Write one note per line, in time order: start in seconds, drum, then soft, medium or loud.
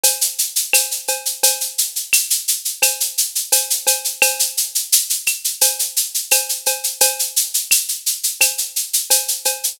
0.03 cowbell medium
0.03 shaker medium
0.21 shaker medium
0.39 shaker medium
0.56 shaker medium
0.73 cowbell medium
0.73 claves medium
0.73 shaker medium
0.91 shaker medium
1.08 cowbell medium
1.08 shaker medium
1.25 shaker medium
1.43 cowbell medium
1.43 shaker loud
1.61 shaker medium
1.78 shaker medium
1.96 shaker medium
2.13 claves medium
2.13 shaker medium
2.30 shaker medium
2.48 shaker medium
2.65 shaker medium
2.82 cowbell medium
2.82 claves medium
2.82 shaker medium
3.00 shaker medium
3.18 shaker medium
3.35 shaker medium
3.52 cowbell medium
3.52 shaker medium
3.70 shaker medium
3.87 cowbell medium
3.87 shaker medium
4.05 shaker medium
4.22 cowbell medium
4.22 claves loud
4.22 shaker medium
4.39 shaker medium
4.57 shaker medium
4.75 shaker medium
4.92 shaker medium
5.10 shaker medium
5.26 claves medium
5.26 shaker medium
5.44 shaker medium
5.61 cowbell medium
5.61 shaker medium
5.79 shaker medium
5.97 shaker medium
6.14 shaker medium
6.31 cowbell medium
6.31 claves medium
6.31 shaker medium
6.49 shaker medium
6.66 cowbell medium
6.66 shaker medium
6.84 shaker medium
7.01 cowbell medium
7.01 shaker medium
7.19 shaker medium
7.36 shaker medium
7.54 shaker medium
7.71 claves medium
7.71 shaker medium
7.88 shaker medium
8.06 shaker medium
8.23 shaker medium
8.41 cowbell medium
8.41 claves medium
8.41 shaker medium
8.58 shaker medium
8.76 shaker medium
8.93 shaker medium
9.10 cowbell medium
9.10 shaker medium
9.28 shaker medium
9.45 cowbell medium
9.45 shaker medium
9.64 shaker medium